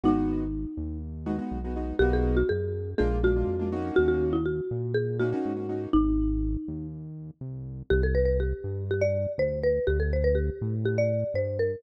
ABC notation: X:1
M:4/4
L:1/16
Q:1/4=122
K:B
V:1 name="Marimba"
D8 z8 | =G ^G2 F G4 G2 F6 | F F2 E F4 G2 F6 | D8 z8 |
[K:C] G A B B G4 G d3 c2 B2 | G A c B G4 G d3 c2 _B2 |]
V:2 name="Acoustic Grand Piano"
[G,B,DF]10 [G,B,DF] [G,B,DF]2 [G,B,DF] [G,B,DF]2 | [A,B,DF]8 [G,A,=D^E]2 [G,A,DE] [G,A,DE]2 [G,A,DE] [A,C^DF]2- | [A,CDF]10 [A,CDF] [A,CDF]2 [A,CDF] [A,CDF]2 | z16 |
[K:C] z16 | z16 |]
V:3 name="Synth Bass 1" clef=bass
G,,,6 D,,6 B,,,4 | B,,,4 F,,4 A,,,4 ^E,,4 | D,,6 A,,6 G,,4 | G,,,6 D,,6 =C,,4 |
[K:C] C,,6 G,,6 D,,4 | D,,6 A,,6 G,,4 |]